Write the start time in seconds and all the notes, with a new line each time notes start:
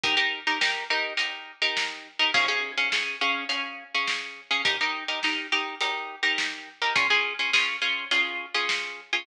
0.04 D#4 G4 A#4, kick, closed hi-hat
0.17 D#4 G4 A#4
0.47 D#4 G4 A#4
0.61 D#4 G4 A#4, snare
0.90 D#4 G4 A#4
1.17 D#4 G4 A#4, closed hi-hat
1.62 D#4 G4 A#4
1.77 snare
2.19 D#4 G4 A#4
2.34 C#4 G#4 F5, kick, crash
2.48 C#4 G#4 F5
2.78 C#4 G#4 F5
2.92 C#4 G#4 F5, snare
3.21 C#4 G#4 F5
3.49 C#4 G#4 F5, closed hi-hat
3.95 C#4 G#4 F5
4.07 snare
4.51 C#4 G#4 F5
4.65 D#4 G4 A#4, kick, closed hi-hat
4.81 D#4 G4 A#4
5.08 D#4 G4 A#4
5.23 D#4 G4 A#4, snare
5.52 D#4 G4 A#4
5.81 D#4 G4 A#4, closed hi-hat
6.23 D#4 G4 A#4
6.38 snare
6.82 D#4 G4 A#4
6.96 C#4 F4 G#4, kick, closed hi-hat
7.10 C#4 F4 G#4
7.39 C#4 F4 G#4
7.53 C#4 F4 G#4, snare
7.82 C#4 F4 G#4
8.11 C#4 F4 G#4, closed hi-hat
8.54 C#4 F4 G#4
8.69 snare
9.13 C#4 F4 G#4